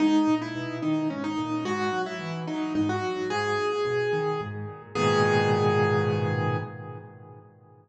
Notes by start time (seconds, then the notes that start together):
0.00 G#2 D#4
0.27 A#2
0.42 E4
0.55 B2
0.82 D#3 D#4
1.10 G#2 C#4
1.24 D#4
1.38 A#2
1.65 G#2 F#4
1.93 F#3
2.06 E4
2.20 E3
2.47 F#3 D#4
2.75 G#2 D#4
2.89 F#4
3.03 F#3
3.30 G#2 G#4
3.58 A#2
3.85 B2
4.13 D#3
4.41 G#2
4.68 A#2
4.95 G#2 A#2 B2 D#3 G#4